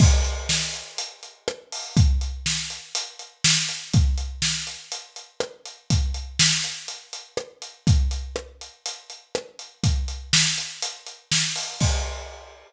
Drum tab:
CC |x-------|--------|--------|--------|
HH |-x-xxx-o|xx-xxx-x|xx-xxx-x|xx-xxx-x|
SD |--o---r-|--o---o-|--o---r-|--o---r-|
BD |o-------|o-------|o-------|o-------|

CC |--------|--------|x-------|
HH |xx-xxx-x|xx-xxx-o|--------|
SD |--r---r-|--o---o-|--------|
BD |o-------|o-------|o-------|